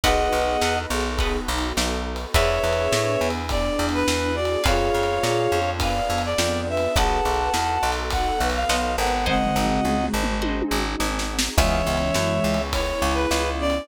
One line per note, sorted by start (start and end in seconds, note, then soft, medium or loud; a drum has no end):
0.03 0.28 B1 medium
0.03 2.32 B3 medium
0.03 2.32 D#4 medium
0.03 2.32 F#4 medium
0.03 0.74 G#4 medium
0.03 2.32 A4 medium
0.03 0.44 B4 medium
0.03 0.74 B4 medium
0.03 0.79 D#5 medium
0.03 0.44 D#5 medium
0.03 0.79 F#5 medium
0.03 0.44 F#5 medium
0.03 0.44 A5 medium
0.03 kick medium
0.03 ride medium
0.32 0.57 B1 medium
0.42 ride medium
0.61 0.86 E2 medium
0.61 1.03 B4 medium
0.61 1.03 D#5 medium
0.61 1.03 F#5 medium
0.61 1.03 A5 medium
0.61 snare loud
0.90 1.39 B1 medium
0.90 1.38 G#4 medium
1.00 ride medium
1.18 1.60 B4 medium
1.18 1.60 D#5 medium
1.18 1.60 F#5 medium
1.18 1.60 A5 medium
1.18 kick medium
1.18 ride medium
1.48 1.73 B1 medium
1.58 ride medium
1.77 2.26 B1 medium
1.77 snare loud
2.16 ride medium
2.34 2.59 E2 loud
2.34 4.63 B3 medium
2.34 4.63 D4 medium
2.34 4.63 E4 medium
2.34 3.31 G#4 medium
2.34 4.63 G#4 medium
2.34 3.31 B4 medium
2.34 2.76 B4 medium
2.34 3.28 C#5 medium
2.34 2.76 D5 medium
2.34 3.28 E5 medium
2.34 2.76 E5 medium
2.34 2.76 G#5 medium
2.34 kick medium
2.34 ride loud
2.63 2.88 E2 medium
2.73 ride medium
2.92 3.17 A2 medium
2.92 snare loud
3.21 3.70 E2 medium
3.30 ride medium
3.49 4.31 D4 medium
3.49 3.86 D5 medium
3.49 kick medium
3.49 ride medium
3.79 4.03 E2 medium
3.89 ride medium
3.94 4.36 B4 medium
4.08 4.57 E2 medium
4.08 snare loud
4.35 4.61 F#4 medium
4.35 4.63 D5 medium
4.45 ride medium
4.64 4.90 F2 medium
4.64 6.94 B3 medium
4.64 6.94 D4 medium
4.64 5.58 F4 medium
4.64 6.94 F4 medium
4.64 5.58 G#4 medium
4.64 6.94 G#4 medium
4.64 5.04 B4 medium
4.64 5.71 C#5 medium
4.64 5.04 D5 medium
4.64 5.04 F5 medium
4.64 5.71 F5 medium
4.64 5.04 G#5 medium
4.64 kick loud
4.64 ride loud
4.94 5.19 F2 medium
5.03 ride medium
5.23 5.48 A#2 medium
5.23 snare loud
5.52 6.01 F2 medium
5.62 ride medium
5.80 6.21 B4 medium
5.80 6.27 D5 medium
5.80 6.21 D5 medium
5.80 6.21 F5 medium
5.80 6.22 F5 medium
5.80 6.21 G#5 medium
5.80 kick medium
5.80 ride loud
6.10 6.34 F2 medium
6.18 ride medium
6.25 6.61 D5 medium
6.38 6.87 F2 medium
6.38 6.67 D5 medium
6.38 snare loud
6.67 6.93 B4 medium
6.67 6.97 E5 medium
6.77 ride medium
6.95 7.21 B1 medium
6.95 9.24 B3 medium
6.95 9.24 D#4 medium
6.95 9.24 F#4 medium
6.95 7.50 G#4 medium
6.95 9.24 A4 medium
6.95 7.50 B4 medium
6.95 7.38 B4 medium
6.95 7.38 D#5 medium
6.95 7.91 F#5 medium
6.95 7.38 F#5 medium
6.95 7.91 A5 medium
6.95 7.38 A5 medium
6.95 kick loud
6.95 ride medium
7.25 7.50 B1 medium
7.34 ride medium
7.54 7.78 E2 medium
7.54 snare loud
7.83 8.32 B1 medium
7.92 ride medium
8.10 8.39 A4 medium
8.10 8.48 F#5 medium
8.10 kick medium
8.10 ride medium
8.40 8.65 B1 medium
8.40 9.13 B4 medium
8.50 ride medium
8.55 8.95 F5 medium
8.69 8.97 B1 medium
8.69 9.10 B4 medium
8.69 9.10 D#5 medium
8.69 9.10 F#5 medium
8.69 9.10 A5 medium
8.69 snare loud
8.98 9.51 G#1 medium
8.98 9.25 F#5 medium
9.07 ride medium
9.26 10.33 G#3 medium
9.26 10.33 C4 medium
9.26 11.56 C4 medium
9.26 11.56 D#4 medium
9.26 11.56 F#4 medium
9.26 11.56 G#4 medium
9.26 9.66 C5 medium
9.26 9.66 D#5 medium
9.26 10.06 D#5 medium
9.26 9.66 F#5 medium
9.26 10.06 F#5 medium
9.26 9.66 G#5 medium
9.26 kick medium
9.26 floor tom medium
9.46 floor tom medium
9.56 9.80 G#1 medium
9.65 floor tom medium
9.84 10.09 C#2 medium
9.84 mid tom medium
10.04 mid tom medium
10.14 10.63 G#1 medium
10.23 mid tom medium
10.42 10.82 C5 medium
10.42 10.82 D#5 medium
10.42 10.82 F#5 medium
10.42 10.82 G#5 medium
10.42 high tom medium
10.62 high tom medium
10.71 10.96 G#1 medium
11.00 11.49 G#1 medium
11.00 snare medium
11.19 snare medium
11.39 snare loud
11.57 11.82 C#2 loud
11.57 12.58 E3 medium
11.57 12.58 G#3 medium
11.57 11.99 B3 medium
11.57 13.87 B3 medium
11.57 11.99 C#4 medium
11.57 13.87 C#4 medium
11.57 11.99 E4 medium
11.57 13.87 E4 medium
11.57 11.99 G#4 medium
11.57 13.87 G#4 medium
11.57 12.62 C#5 medium
11.57 12.62 E5 medium
11.57 kick loud
11.57 crash medium
11.87 12.11 C#2 medium
11.97 ride medium
12.14 12.40 F#2 medium
12.14 snare loud
12.44 12.93 C#2 medium
12.54 ride medium
12.73 13.43 E4 medium
12.73 13.14 C#5 medium
12.73 kick medium
12.73 ride loud
13.02 13.26 C#2 medium
13.11 13.50 B4 medium
13.11 ride medium
13.31 13.80 C#2 medium
13.31 snare loud
13.59 13.82 C#4 medium
13.59 13.87 D5 medium
13.70 ride medium